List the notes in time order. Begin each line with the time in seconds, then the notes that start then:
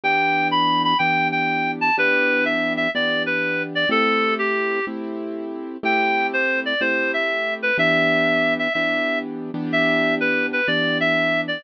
0.04 E3 B3 D4 G4 G5
0.51 B5
0.84 B5
0.99 E3 B3 D4 G4 G5
1.32 G5
1.81 A5
1.97 E3 B3 D4 G4 B4
2.45 E5
2.77 E5
2.95 E3 B3 D4 G4 D5
3.26 B4
3.75 D5
3.89 A3 C4 E4 G4 A4
4.39 G4
4.87 A3 C4 E4 G4
5.83 A3 C4 E4 G4 G5
6.33 C5
6.66 D5
6.81 A3 C4 E4 G4 C5
7.14 E5
7.63 B4
7.78 E3 B3 D4 G4 E5
8.59 E5
8.74 E3 B3 D4 G4 E5
9.54 E3 B3 D4 G4
9.72 E5
10.20 B4
10.53 B4
10.67 E3 B3 D4 G4 D5
11.00 E5
11.48 D5